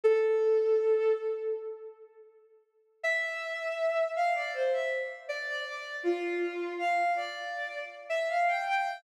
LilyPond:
\new Staff { \time 4/4 \key a \minor \tempo 4 = 80 a'4. r2 r8 | e''4. f''16 d''16 c''16 e''16 r8 d''16 d''16 d''8 | f'4 f''8 d''4 r16 e''16 f''16 g''16 g''8 | }